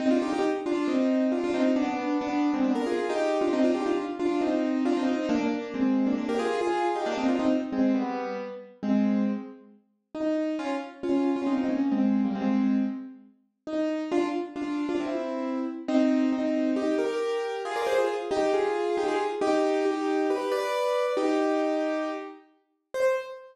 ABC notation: X:1
M:4/4
L:1/16
Q:1/4=136
K:Cm
V:1 name="Acoustic Grand Piano"
[CE] [DF] [EG] [EG] z2 [DF]2 [CE]4 [DF] [DF] [CE]2 | [=B,D] [B,D]3 [B,D]3 [A,C] [B,D] _B [FA]2 [EG]3 [DF] | [CE] [DF] [EG] [DF] z2 [DF]2 [CE]4 [DF] [CE] [CE]2 | [B,D] [B,D]3 [A,C]3 [B,D] [B,D] [GB] [FA]2 [FA]3 [EG] |
[B,D] [CE] [DF] [CE] z2 [A,C]2 [G,=B,]4 z4 | [K:Fm] [A,C]4 z8 E4 | [DF] z3 [DF]3 [DF] [CE] [CE] [B,D]2 [A,C]3 [G,B,] | [A,C]4 z8 E4 |
[=DF] z3 [DF]3 [DF] [C=E]6 z2 | [K:Cm] [CE]4 [CE]4 [EG]2 [GB]6 | [FA] [Bd] [Ac] [FA] z2 [EG]2 [FA]4 [EG] [FA] z2 | [EG]4 [EG]4 [G=B]2 [Bd]6 |
[EG]10 z6 | c4 z12 |]